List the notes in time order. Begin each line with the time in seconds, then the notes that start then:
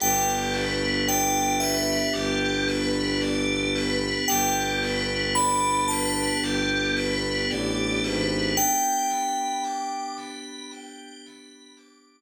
0.00 G1 B3 D4 G4 G5
0.54 B4
1.08 D5 G5
1.60 B4 E5
2.13 G1 G4
2.68 B4
3.21 D5
3.75 B4
4.28 G1 B3 D4 G4 G5
4.83 B4
5.35 D5 B5
5.88 B4 A5
6.42 G1 G4
6.97 B4
7.50 A1 D5
8.04 G#1 B4
8.57 B3 D4 G4 G5
9.11 B5
9.64 D6
10.17 B5
10.72 G5
11.26 B5
11.77 D6